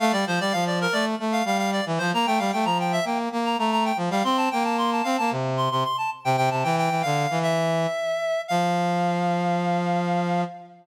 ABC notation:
X:1
M:4/4
L:1/16
Q:1/4=113
K:F
V:1 name="Clarinet"
f d c d f d B d z2 f f f d z c | b g f g b g e g z2 b b b g z f | c' a g a c' a f a z2 c' c' c' a z g | g a g g2 f3 e8 |
f16 |]
V:2 name="Brass Section"
A, G, F, G, F,3 A,2 A,2 G,3 E, F, | B, A, G, A, F,3 B,2 B,2 A,3 F, G, | C2 B,4 C B, C,3 C, z3 C, | C, C, E,2 E, D,2 E,5 z4 |
F,16 |]